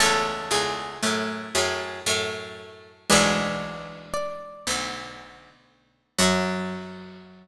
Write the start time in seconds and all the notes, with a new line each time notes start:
0.00 C#2 E2 A3 C#4 A4
0.51 C#2 E2 G#4
1.03 F#2 A2 A3
1.55 F#2 A2 G#4
2.06 F#2 A2 A3
3.10 B1 D2 E3 G#3 D4 G#4 B4
4.14 D5
4.67 B1 D2
6.19 F#2 F#3 F#4 F#5